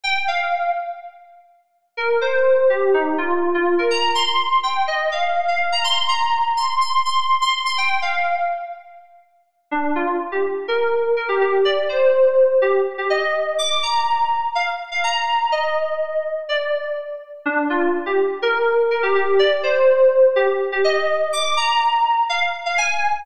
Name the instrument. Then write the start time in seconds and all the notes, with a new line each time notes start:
electric piano 2
0.04 G5
0.28 F5
1.97 A#4
2.21 C5
2.70 G4
2.94 D#4
3.18 F4
3.54 F4
3.79 A#4
3.91 A#5
4.15 C6
4.63 G5
4.87 D#5
5.12 F5
5.48 F5
5.72 A#5
5.84 C6
6.08 A#5
6.57 C6
6.81 C6
7.05 C6
7.41 C6
7.66 C6
7.78 G5
8.02 F5
9.71 D4
9.95 F4
10.32 G4
10.68 A#4
11.16 A#4
11.29 G4
11.41 G4
11.65 D5
11.89 C5
12.62 G4
12.98 G4
13.10 D#5
13.58 D6
13.83 A#5
14.55 F5
14.91 F5
15.04 A#5
15.52 D#5
16.49 D5
17.45 D4
17.70 F4
18.06 G4
18.42 A#4
18.91 A#4
19.03 G4
19.15 G4
19.39 D5
19.63 C5
20.36 G4
20.72 G4
20.84 D#5
21.33 D6
21.57 A#5
22.29 F5
22.66 F5
22.78 G#5